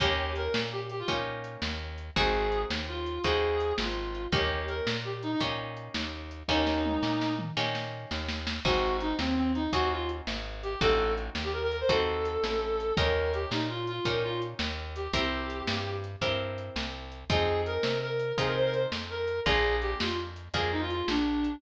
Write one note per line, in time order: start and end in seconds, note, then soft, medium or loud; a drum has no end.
0.00 0.48 D#2 loud
0.00 0.97 A#3 loud
0.00 0.97 C#4 medium
0.00 0.97 D#4 loud
0.00 0.32 G4 loud
0.00 0.97 G4 loud
0.00 kick medium
0.00 closed hi-hat medium
0.36 0.61 A#4 medium
0.36 closed hi-hat medium
0.54 1.03 A#2 medium
0.54 snare loud
0.72 0.81 G4 medium
0.89 0.99 G4 medium
0.89 closed hi-hat medium
0.99 1.08 F4 medium
1.08 1.57 A#2 medium
1.08 2.05 A#3 medium
1.08 2.05 C#4 medium
1.08 2.05 D#4 medium
1.08 2.05 G4 medium
1.08 kick medium
1.08 closed hi-hat medium
1.44 closed hi-hat medium
1.62 2.11 D#2 medium
1.62 snare medium
1.98 closed hi-hat medium
2.16 2.65 G#1 loud
2.16 3.14 C4 loud
2.16 3.14 D#4 medium
2.16 3.14 F#4 loud
2.16 3.14 G#4 loud
2.16 2.62 G#4 medium
2.16 kick medium
2.16 closed hi-hat medium
2.52 closed hi-hat medium
2.70 3.19 D#2 medium
2.70 snare medium
2.88 3.21 F4 medium
3.06 closed hi-hat medium
3.24 3.73 D#2 loud
3.24 4.22 C4 medium
3.24 4.22 D#4 loud
3.24 4.22 F#4 medium
3.24 4.22 G#4 medium
3.24 3.73 G#4 medium
3.24 kick medium
3.24 closed hi-hat medium
3.60 closed hi-hat medium
3.78 4.27 G#1 medium
3.78 4.23 F4 medium
3.78 snare loud
4.15 closed hi-hat medium
4.32 4.81 D#2 loud
4.32 5.30 A#3 loud
4.32 5.30 C#4 medium
4.32 5.30 D#4 loud
4.32 5.30 G4 loud
4.32 4.65 G4 medium
4.32 kick loud
4.32 closed hi-hat medium
4.68 4.91 A#4 medium
4.68 closed hi-hat medium
4.87 5.35 A#2 medium
4.87 snare loud
5.05 5.13 G4 medium
5.23 5.31 D#4 medium
5.23 closed hi-hat medium
5.32 5.40 D#4 medium
5.40 5.89 A#2 medium
5.40 6.38 A#3 medium
5.40 6.38 C#4 medium
5.40 6.38 D#4 medium
5.40 6.38 G4 medium
5.40 kick medium
5.40 closed hi-hat medium
5.77 closed hi-hat medium
5.94 6.43 D#2 medium
5.94 snare medium
6.31 closed hi-hat medium
6.48 6.98 D#2 loud
6.48 7.46 A#3 loud
6.48 7.46 C#4 medium
6.48 7.46 D#4 medium
6.48 7.34 D#4 loud
6.48 7.46 G4 loud
6.48 kick medium
6.48 snare medium
6.67 snare medium
6.85 high tom medium
7.03 7.51 A#2 medium
7.03 snare medium
7.21 snare medium
7.39 mid tom medium
7.57 8.06 A#2 medium
7.57 8.54 A#3 medium
7.57 8.54 C#4 medium
7.57 8.54 D#4 medium
7.57 8.54 G4 loud
7.57 snare medium
7.75 snare medium
8.11 8.60 D#2 loud
8.11 snare medium
8.28 snare medium
8.47 snare medium
8.65 9.14 G#1 loud
8.65 9.62 C4 loud
8.65 9.62 D#4 loud
8.65 8.97 F#4 loud
8.65 9.62 F#4 loud
8.65 9.62 G#4 medium
8.65 kick medium
8.65 crash medium
9.00 9.15 D#4 medium
9.00 closed hi-hat medium
9.19 9.68 D#2 medium
9.19 9.36 C4 medium
9.19 snare medium
9.37 9.52 C4 medium
9.55 9.71 D#4 medium
9.55 closed hi-hat medium
9.73 10.21 D#2 medium
9.73 10.70 C4 medium
9.73 10.70 D#4 medium
9.73 9.90 F#4 medium
9.73 10.70 F#4 medium
9.73 10.70 G#4 medium
9.73 kick medium
9.73 closed hi-hat loud
9.91 10.07 F4 medium
10.09 closed hi-hat medium
10.27 10.76 G#1 medium
10.27 snare medium
10.63 10.80 G4 medium
10.63 closed hi-hat medium
10.81 11.30 A1 loud
10.81 11.78 C4 loud
10.81 11.78 D#4 loud
10.81 11.78 F#4 loud
10.81 11.12 A4 medium
10.81 11.78 A4 loud
10.81 kick medium
10.81 closed hi-hat medium
11.17 closed hi-hat medium
11.35 11.84 D#2 medium
11.35 snare medium
11.44 11.53 G4 medium
11.53 11.62 A#4 medium
11.62 11.71 A#4 loud
11.71 11.80 A#4 medium
11.71 closed hi-hat medium
11.80 11.89 C5 medium
11.89 12.38 D#2 medium
11.89 12.86 C4 medium
11.89 12.86 D#4 medium
11.89 12.86 F#4 loud
11.89 12.86 A4 medium
11.89 12.93 A4 medium
11.89 kick medium
11.89 closed hi-hat medium
12.25 closed hi-hat medium
12.44 12.92 A1 medium
12.44 snare medium
12.80 closed hi-hat medium
12.97 13.46 D#2 loud
12.97 13.95 C#4 medium
12.97 13.95 D#4 loud
12.97 13.95 G4 loud
12.97 13.95 A#4 medium
12.97 13.32 A#4 medium
12.97 kick loud
12.97 closed hi-hat medium
13.33 13.50 G4 medium
13.33 closed hi-hat medium
13.51 14.00 A#2 medium
13.51 13.67 D#4 medium
13.51 snare medium
13.69 13.84 F4 medium
13.87 14.04 F4 medium
13.87 closed hi-hat medium
14.05 14.54 A#2 medium
14.05 15.03 C#4 medium
14.05 15.03 D#4 medium
14.05 15.03 G4 medium
14.05 14.23 A#4 medium
14.05 15.03 A#4 medium
14.05 kick medium
14.05 closed hi-hat loud
14.24 14.38 F4 medium
14.42 closed hi-hat medium
14.59 15.08 D#2 loud
14.59 snare loud
14.96 15.12 G4 medium
14.96 closed hi-hat medium
15.13 15.62 C2 loud
15.13 16.11 C4 loud
15.13 16.11 E4 medium
15.13 16.11 G4 loud
15.13 15.91 G4 medium
15.13 16.11 A#4 loud
15.13 kick medium
15.13 closed hi-hat loud
15.50 closed hi-hat medium
15.67 16.16 G2 medium
15.67 snare loud
16.04 closed hi-hat medium
16.21 16.70 G2 medium
16.21 17.19 C4 loud
16.21 17.19 E4 medium
16.21 17.19 G4 loud
16.21 17.19 A#4 medium
16.21 kick medium
16.21 closed hi-hat medium
16.58 closed hi-hat medium
16.76 17.24 C2 medium
16.76 snare medium
17.12 closed hi-hat medium
17.30 17.78 F2 loud
17.30 18.27 C4 loud
17.30 18.27 D#4 loud
17.30 18.27 F4 loud
17.30 18.27 G#4 loud
17.30 17.61 G#4 loud
17.30 kick loud
17.30 closed hi-hat medium
17.66 18.00 A#4 medium
17.66 closed hi-hat medium
17.83 18.33 C3 medium
17.83 snare medium
18.02 18.32 A#4 medium
18.20 closed hi-hat medium
18.38 18.86 C3 loud
18.38 19.35 C4 medium
18.38 19.35 D#4 medium
18.38 19.35 F4 medium
18.38 19.35 G#4 medium
18.38 18.46 G#4 medium
18.38 kick medium
18.38 closed hi-hat medium
18.47 18.55 A#4 medium
18.56 18.64 C5 medium
18.65 18.73 A#4 medium
18.73 18.83 C5 medium
18.73 closed hi-hat medium
18.92 19.40 F2 medium
18.92 snare medium
19.10 19.40 A#4 medium
19.28 closed hi-hat medium
19.46 19.95 A#1 loud
19.46 20.43 A#3 loud
19.46 20.43 D4 medium
19.46 20.43 F4 medium
19.46 20.43 G#4 loud
19.46 19.76 G#4 loud
19.46 kick medium
19.46 closed hi-hat medium
19.82 19.98 G4 medium
19.82 closed hi-hat medium
20.00 20.49 F2 medium
20.00 20.15 F4 medium
20.00 snare loud
20.36 closed hi-hat medium
20.54 21.02 F2 medium
20.54 21.51 A#3 medium
20.54 21.51 D4 medium
20.54 21.51 F4 loud
20.54 21.51 G#4 medium
20.54 20.71 G#4 medium
20.54 kick medium
20.54 closed hi-hat loud
20.72 20.81 D#4 medium
20.81 20.90 F4 medium
20.90 21.05 F4 medium
20.90 closed hi-hat medium
21.08 21.56 A#1 medium
21.08 21.55 D4 medium
21.08 snare medium
21.44 closed hi-hat medium